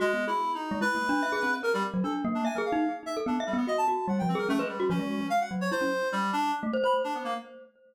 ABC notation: X:1
M:2/4
L:1/16
Q:1/4=147
K:none
V:1 name="Clarinet"
(3_A,4 E4 _E4 | B8 | _B G, z2 A z2 D | _a _B f3 z e z |
D z G, B, _e a a2 | _g =g C _B A, _A, G,2 | _D4 f _g z _d | c4 G,2 D2 |
z3 b z D B, _B, |]
V:2 name="Glockenspiel"
(3_G2 B,2 _A2 z3 _A, | (3E2 _B,2 D2 e _A C2 | _B G z _G, D2 _B,2 | (3e2 _A2 _E2 z3 =A |
(3B,2 e2 B,2 _G2 G2 | (3G,2 F,2 _A2 _D B z _G | F, _A,2 z3 _G,2 | E _D z6 |
z A, c c2 z3 |]